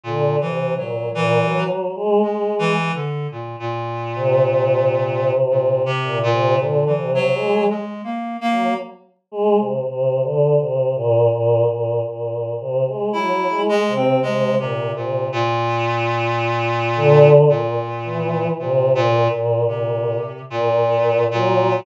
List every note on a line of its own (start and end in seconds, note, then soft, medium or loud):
0.03 0.36 A#2 medium
0.03 0.37 D3 medium
0.41 0.74 C3 medium
0.41 0.74 E3 medium
0.76 1.09 A#2 medium
0.76 1.10 F#3 medium
1.15 1.39 A#2 medium
1.15 1.64 E3 loud
1.41 1.90 F#3 medium
1.96 2.20 G#3 loud
2.22 2.55 G#3 medium
2.22 2.72 G#3 medium
2.59 2.92 E3 loud
2.95 3.27 D3 medium
3.32 3.56 A#2 medium
3.60 5.31 A#2 medium
4.15 4.40 C3 loud
4.41 5.88 C3 medium
5.50 5.83 A#2 medium
5.86 6.18 C3 loud
6.03 6.28 A#2 medium
6.23 6.56 A#2 loud
6.32 6.57 C3 medium
6.58 6.84 A#2 medium
6.58 6.91 D3 medium
6.86 7.11 E3 medium
6.96 7.29 C3 medium
7.15 7.64 F#3 loud
7.34 7.66 G#3 medium
7.69 8.02 G#3 medium
8.04 8.37 A#3 medium
8.41 8.74 A#3 loud
8.51 8.75 F#3 medium
9.31 9.56 G#3 loud
9.58 9.83 C3 medium
9.87 10.20 C3 medium
10.23 10.56 D3 medium
10.60 10.93 C3 medium
10.95 11.28 A#2 loud
11.31 11.64 A#2 loud
11.68 12.00 A#2 medium
12.05 12.54 A#2 medium
12.60 12.85 C3 medium
12.87 13.12 G#3 medium
13.13 13.47 F#3 medium
13.13 13.62 E4 loud
13.50 13.82 G#3 medium
13.69 13.93 G#3 loud
13.88 14.20 C3 medium
13.95 14.20 C4 medium
14.22 14.55 C3 medium
14.22 14.55 G#3 loud
14.58 14.91 A#2 medium
14.58 14.92 C3 medium
14.96 15.28 A#2 medium
14.96 15.28 C3 medium
15.32 17.29 A#2 loud
16.95 17.45 D3 loud
17.49 18.47 A#2 medium
17.49 17.75 A#2 medium
18.04 18.53 E3 medium
18.59 18.92 A#2 medium
18.59 18.92 C3 medium
18.95 19.28 A#2 loud
18.95 19.29 A#2 medium
19.31 19.64 A#2 soft
19.31 19.65 A#2 medium
19.67 20.16 A#2 medium
19.67 20.42 C3 medium
20.50 21.24 A#2 loud
20.50 21.25 A#2 medium
21.31 21.80 A#2 loud
21.31 21.82 F#3 medium